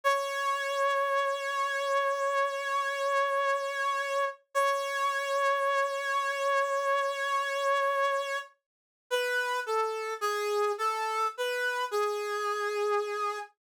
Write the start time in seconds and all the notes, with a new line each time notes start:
0.04 C#5
4.54 C#5
9.11 B4
9.66 A4
10.21 G#4
10.78 A4
11.37 B4
11.91 G#4